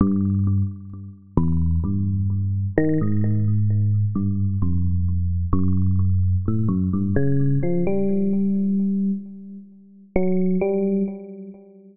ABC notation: X:1
M:6/4
L:1/16
Q:1/4=65
K:none
V:1 name="Electric Piano 1" clef=bass
G,,3 z3 E,,2 G,,4 ^D, ^G,,5 =G,,2 F,,4 | ^F,,4 A,, F,, G,, ^C,2 =F, G,6 z4 ^F,2 G,2 |]